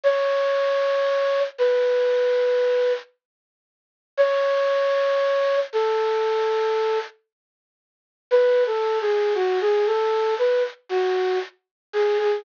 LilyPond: \new Staff { \time 4/4 \key cis \minor \tempo 4 = 58 cis''4. b'4. r4 | cis''4. a'4. r4 | \tuplet 3/2 { b'8 a'8 gis'8 } fis'16 gis'16 a'8 b'16 r16 fis'8 r8 gis'16 gis'16 | }